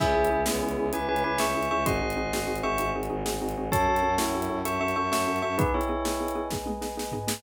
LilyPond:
<<
  \new Staff \with { instrumentName = "Tubular Bells" } { \time 12/8 \key cis \minor \tempo 4. = 129 <gis' e''>4. <b gis'>4. <b' gis''>8 <b' gis''>8 <b' gis''>8 <e'' cis'''>4 <e'' cis'''>8 | <dis'' bis''>2~ <dis'' bis''>8 <e'' cis'''>4 r2 r8 | <cis'' a''>4. <e' cis''>4. <e'' cis'''>8 <e'' cis'''>8 <e'' cis'''>8 <e'' cis'''>4 <e'' cis'''>8 | <dis' b'>8 <e' cis''>2~ <e' cis''>8 r2. | }
  \new Staff \with { instrumentName = "Xylophone" } { \time 12/8 \key cis \minor <cis' e' gis'>8 <cis' e' gis'>8 <cis' e' gis'>8 <cis' e' gis'>8 <cis' e' gis'>8 <cis' e' gis'>8 <cis' e' gis'>8 <cis' e' gis'>8 <cis' e' gis'>8 <cis' e' gis'>8 <cis' e' gis'>8 <cis' e' gis'>8 | <bis dis' fis' gis'>8 <bis dis' fis' gis'>8 <bis dis' fis' gis'>8 <bis dis' fis' gis'>8 <bis dis' fis' gis'>8 <bis dis' fis' gis'>8 <bis dis' fis' gis'>8 <bis dis' fis' gis'>8 <bis dis' fis' gis'>8 <bis dis' fis' gis'>8 <bis dis' fis' gis'>8 <bis dis' fis' gis'>8 | <cis' fis' a'>8 <cis' fis' a'>8 <cis' fis' a'>8 <cis' fis' a'>8 <cis' fis' a'>8 <cis' fis' a'>8 <cis' fis' a'>8 <cis' fis' a'>8 <cis' fis' a'>8 <cis' fis' a'>8 <cis' fis' a'>8 <cis' fis' a'>8 | <b dis' gis'>8 <b dis' gis'>8 <b dis' gis'>8 <b dis' gis'>8 <b dis' gis'>8 <b dis' gis'>8 <b dis' gis'>8 <b dis' gis'>8 <b dis' gis'>8 <b dis' gis'>8 <b dis' gis'>8 <b dis' gis'>8 | }
  \new Staff \with { instrumentName = "Violin" } { \clef bass \time 12/8 \key cis \minor cis,8 cis,8 cis,8 cis,8 cis,8 cis,8 cis,8 cis,8 cis,8 cis,8 cis,8 cis,8 | gis,,8 gis,,8 gis,,8 gis,,8 gis,,8 gis,,8 gis,,8 gis,,8 gis,,8 gis,,8 gis,,8 gis,,8 | fis,8 fis,8 fis,8 fis,8 fis,8 fis,8 fis,8 fis,8 fis,8 fis,8 fis,8 fis,8 | r1. | }
  \new Staff \with { instrumentName = "Brass Section" } { \time 12/8 \key cis \minor <cis'' e'' gis''>1. | <bis' dis'' fis'' gis''>1. | <cis'' fis'' a''>1. | <b' dis'' gis''>1. | }
  \new DrumStaff \with { instrumentName = "Drums" } \drummode { \time 12/8 <cymc bd>8. hh8. sn8. hh8. hh8. hh8. sn8. hh8. | <hh bd>8. hh8. sn8. hh8. hh8. hh8. sn8. hh8. | <hh bd>8. hh8. sn8. hh8. hh8. hh8. sn8. hh8. | <hh bd>8. hh8. sn8. hh8. <bd sn>8 tommh8 sn8 sn8 tomfh8 sn8 | }
>>